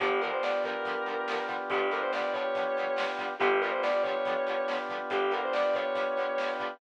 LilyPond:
<<
  \new Staff \with { instrumentName = "Distortion Guitar" } { \time 4/4 \key g \mixolydian \tempo 4 = 141 g'8 ais'16 c''16 d''8 ais'2 r8 | g'8 ais'16 c''16 d''8 cis''2 r8 | g'8 ais'16 c''16 d''8 cis''2 r8 | g'8 ais'16 c''16 d''8 cis''2 r8 | }
  \new Staff \with { instrumentName = "Acoustic Guitar (steel)" } { \time 4/4 \key g \mixolydian <d f g b>8 <d f g b>8 <d f g b>8 <d f g b>8 <d f g b>8 <d f g b>8 <d f g b>8 <d f g b>8 | <d f g b>8 <d f g b>8 <d f g b>8 <d f g b>8 <d f g b>8 <d f g b>8 <d f g b>8 <d f g b>8 | <d f g b>8 <d f g b>8 <d f g b>8 <d f g b>8 <d f g b>8 <d f g b>8 <d f g b>8 <d f g b>8 | <d f g b>8 <d f g b>8 <d f g b>8 <d f g b>8 <d f g b>8 <d f g b>8 <d f g b>8 <d f g b>8 | }
  \new Staff \with { instrumentName = "Drawbar Organ" } { \time 4/4 \key g \mixolydian <b d' f' g'>1~ | <b d' f' g'>1 | <b d' f' g'>1~ | <b d' f' g'>1 | }
  \new Staff \with { instrumentName = "Electric Bass (finger)" } { \clef bass \time 4/4 \key g \mixolydian g,,1 | g,,1 | g,,1 | g,,1 | }
  \new DrumStaff \with { instrumentName = "Drums" } \drummode { \time 4/4 <hh bd>8 hh8 sn8 <hh bd>8 <hh bd>8 hh8 sn8 <hh bd>8 | <hh bd>8 hh8 sn8 <hh bd>8 <hh bd>8 hh8 sn8 <hh bd>8 | <hh bd>8 hh8 sn8 <hh bd>8 <hh bd>8 hh8 sn8 <hh bd>8 | <hh bd>8 hh8 sn8 <hh bd>8 <hh bd>8 hh8 sn8 <hh bd>8 | }
>>